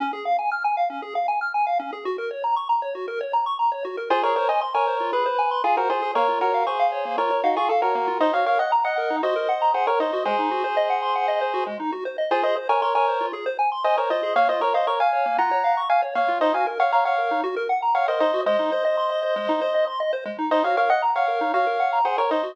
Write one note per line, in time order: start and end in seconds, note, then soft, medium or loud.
0.00 0.12 C#4 loud
0.13 0.24 G#4 medium
0.25 0.37 F5 medium
0.39 0.50 G#5 medium
0.52 0.63 F6 medium
0.64 0.76 G#5 medium
0.77 0.89 F5 medium
0.90 1.01 C#4 medium
1.02 1.14 G#4 medium
1.15 1.27 F5 medium
1.28 1.40 G#5 medium
1.41 1.53 F6 medium
1.54 1.66 G#5 medium
1.67 1.78 F5 medium
1.79 1.91 C#4 medium
1.93 2.04 G#4 medium
2.05 2.17 F#4 medium
2.18 2.30 A#4 medium
2.31 2.42 C#5 medium
2.44 2.55 A#5 medium
2.56 2.68 C#6 medium
2.69 2.81 A#5 medium
2.82 2.94 C#5 medium
2.95 3.06 F#4 medium
3.08 3.19 A#4 medium
3.21 3.32 C#5 medium
3.33 3.45 A#5 medium
3.46 3.58 C#6 medium
3.59 3.71 A#5 medium
3.72 3.83 C#5 medium
3.85 3.96 F#4 medium
3.97 4.09 A#4 medium
4.10 4.22 F4 loud
4.10 4.23 G#4 loud
4.10 4.23 C5 loud
4.23 4.35 G#4 medium
4.23 4.35 A#4 medium
4.23 4.35 C#5 loud
4.36 4.48 A#4 medium
4.36 4.48 C5 medium
4.36 4.48 C#5 loud
4.49 4.61 C5 medium
4.49 4.61 D#5 medium
4.49 4.60 G#5 medium
4.61 4.73 C6 medium
4.74 5.11 A#4 medium
4.74 5.11 C#5 loud
4.74 4.86 G#5 medium
4.87 4.99 C5 medium
5.00 5.12 F4 medium
5.13 5.24 G#4 medium
5.13 5.62 B4 loud
5.26 5.37 C5 medium
5.39 5.50 G#5 medium
5.51 5.63 C6 medium
5.64 5.76 F4 medium
5.64 5.76 G#4 loud
5.64 5.76 G#5 medium
5.77 5.89 F#4 medium
5.77 5.89 A#4 loud
5.77 5.89 C5 medium
5.90 6.01 F4 medium
5.90 6.12 G#4 medium
5.90 6.12 C5 loud
6.02 6.14 G#4 medium
6.15 6.27 A#3 medium
6.15 6.39 A#4 loud
6.15 6.39 C#5 loud
6.28 6.40 F4 medium
6.41 6.64 F#4 medium
6.41 6.64 A#4 loud
6.41 6.52 C#5 medium
6.54 6.66 F5 medium
6.67 7.16 G#4 medium
6.67 7.16 C5 medium
6.67 6.78 C#6 medium
6.79 6.91 F5 medium
6.92 7.04 C#5 medium
7.05 7.17 A#3 medium
7.18 7.29 F4 medium
7.18 7.41 A#4 medium
7.18 7.41 C#5 medium
7.31 7.42 C#5 medium
7.44 7.56 D#4 medium
7.44 7.56 F#4 medium
7.44 7.55 F5 medium
7.56 7.69 F4 medium
7.56 7.69 G#4 loud
7.56 7.68 C#6 medium
7.69 7.81 A4 medium
7.69 7.81 F5 medium
7.82 8.18 F#4 medium
7.82 8.18 A#4 loud
7.82 7.93 C#5 medium
7.95 8.07 A#3 medium
8.08 8.19 F4 medium
8.20 8.32 D#4 loud
8.20 8.33 C5 loud
8.20 8.33 D#5 loud
8.33 8.45 F#4 medium
8.33 8.46 C#5 medium
8.33 8.46 F5 loud
8.46 8.58 A#4 medium
8.46 8.59 C#5 medium
8.46 8.59 F5 loud
8.59 8.71 D#5 medium
8.59 8.71 F#5 medium
8.59 8.71 F#5 loud
8.72 8.84 A#5 medium
8.84 9.16 D#5 medium
8.84 8.96 F#5 medium
8.84 9.16 F#5 medium
8.98 9.09 A#4 medium
9.10 9.22 D#4 medium
9.23 9.35 F#4 medium
9.23 9.71 C5 medium
9.23 9.71 D#5 medium
9.36 9.47 A#4 medium
9.49 9.60 F#5 medium
9.62 9.73 A#5 medium
9.74 9.86 G#4 medium
9.74 9.86 C5 medium
9.74 9.86 F#5 medium
9.87 9.99 A#4 medium
9.87 9.99 A#4 loud
9.87 9.99 C#5 loud
10.00 10.11 D#4 medium
10.00 10.23 C5 medium
10.00 10.23 D#5 medium
10.13 10.25 F#4 medium
10.25 10.37 G#3 medium
10.25 11.64 G#4 loud
10.25 11.64 C5 loud
10.38 10.50 D#4 medium
10.51 10.63 F#4 medium
10.64 10.76 C5 medium
10.77 10.88 D#5 medium
10.90 11.01 F#5 medium
11.02 11.14 C6 medium
11.15 11.27 F#5 medium
11.28 11.40 D#5 medium
11.41 11.53 C5 medium
11.54 11.65 F#4 medium
11.66 11.78 G#3 medium
11.80 11.91 D#4 medium
11.92 12.04 F#4 medium
12.05 12.17 C5 medium
12.18 12.30 D#5 medium
12.31 12.42 F4 loud
12.31 12.43 G#4 loud
12.31 12.43 C5 loud
12.43 12.55 G#4 medium
12.43 12.56 C5 loud
12.43 12.56 D#5 loud
12.56 12.68 C5 medium
12.69 12.81 A#4 medium
12.69 12.81 C#5 loud
12.69 12.81 G#5 medium
12.82 12.94 A#4 medium
12.82 12.94 C#5 medium
12.82 12.94 C6 medium
12.95 13.26 A#4 loud
12.95 13.26 C#5 loud
12.95 13.06 G#5 medium
13.08 13.19 C5 medium
13.21 13.32 F4 medium
13.33 13.45 G#4 medium
13.46 13.57 C5 medium
13.59 13.70 G#5 medium
13.72 13.83 C6 medium
13.84 13.97 C5 loud
13.84 13.97 D#5 loud
13.84 13.96 G#5 medium
13.97 14.10 A#4 medium
13.97 14.09 C5 medium
13.97 14.10 C#5 medium
14.10 14.22 F4 medium
14.10 14.34 C5 medium
14.10 14.34 D#5 loud
14.23 14.35 G#4 medium
14.36 14.47 A#3 medium
14.36 14.48 C#5 loud
14.36 14.48 F5 loud
14.49 14.60 F4 medium
14.49 14.61 C5 loud
14.49 14.61 D#5 loud
14.61 14.73 A#4 loud
14.61 14.73 C#5 loud
14.61 14.73 C#5 medium
14.74 14.87 C5 medium
14.74 14.87 D#5 loud
14.74 14.86 F5 medium
14.87 14.99 A#4 medium
14.87 14.99 C#5 medium
14.87 14.99 C#6 medium
15.00 15.37 F5 medium
15.00 15.12 F5 medium
15.00 15.37 G#5 medium
15.13 15.24 C#5 medium
15.26 15.37 A#3 medium
15.38 15.50 F4 medium
15.38 15.80 F#5 medium
15.38 15.80 A#5 medium
15.51 15.63 C#5 medium
15.64 15.75 F5 medium
15.77 15.89 C#6 medium
15.90 16.01 F5 medium
15.90 16.02 F5 medium
15.90 16.02 G#5 medium
16.02 16.14 C#5 medium
16.15 16.27 A#3 medium
16.15 16.39 C#5 medium
16.15 16.39 F5 loud
16.28 16.40 F4 medium
16.41 16.53 D#4 medium
16.41 16.53 C5 loud
16.41 16.53 D#5 loud
16.54 16.65 F#4 medium
16.54 16.66 F5 medium
16.54 16.66 G#5 medium
16.67 16.78 A#4 medium
16.80 16.92 C#5 medium
16.80 16.92 F5 loud
16.80 16.91 F#5 medium
16.92 17.04 C#5 medium
16.92 17.04 F5 loud
16.92 17.04 A#5 medium
17.05 17.41 C#5 medium
17.05 17.41 F5 loud
17.05 17.17 F#5 medium
17.18 17.29 A#4 medium
17.31 17.43 D#4 medium
17.44 17.55 F#4 loud
17.56 17.68 A#4 medium
17.69 17.81 F#5 medium
17.82 17.94 A#5 medium
17.95 18.07 C#5 medium
17.95 18.07 F5 medium
17.95 18.06 F#5 medium
18.08 18.19 A#4 medium
18.08 18.20 C5 medium
18.08 18.20 D#5 loud
18.20 18.32 D#4 medium
18.20 18.41 C5 loud
18.20 18.41 D#5 loud
18.34 18.45 F#4 medium
18.46 18.58 G#3 loud
18.46 19.85 C5 loud
18.46 19.85 D#5 loud
18.59 18.71 D#4 medium
18.72 18.84 C5 medium
18.85 18.96 D#5 medium
18.97 19.09 C6 medium
19.10 19.22 D#5 medium
19.23 19.35 C5 medium
19.36 19.48 G#3 medium
19.49 19.60 D#4 medium
19.61 19.73 C5 medium
19.74 19.86 D#5 medium
19.87 19.99 C6 medium
20.00 20.12 D#5 medium
20.13 20.24 C5 medium
20.25 20.37 G#3 medium
20.38 20.50 D#4 medium
20.51 20.63 D#4 medium
20.51 20.63 C5 loud
20.51 20.63 D#5 loud
20.64 20.76 F#4 medium
20.64 20.76 C#5 medium
20.64 20.76 F5 loud
20.77 20.89 A#4 medium
20.77 20.89 C#5 medium
20.77 20.89 F5 loud
20.90 21.02 D#5 loud
20.90 21.01 F#5 medium
20.90 21.02 F#5 loud
21.02 21.14 A#5 medium
21.15 21.52 C#5 medium
21.15 21.52 F5 loud
21.15 21.27 F#5 medium
21.28 21.39 A#4 medium
21.41 21.52 D#4 medium
21.54 21.65 F#4 medium
21.54 21.99 C#5 medium
21.54 21.99 F5 loud
21.67 21.78 A#4 medium
21.80 21.91 F#5 medium
21.93 22.04 A#5 medium
22.05 22.17 G#4 medium
22.05 22.17 C5 loud
22.05 22.16 F#5 medium
22.18 22.29 A#4 medium
22.18 22.30 A#4 loud
22.18 22.30 C#5 loud
22.31 22.43 D#4 medium
22.31 22.52 C5 medium
22.31 22.52 D#5 loud
22.43 22.55 F#4 medium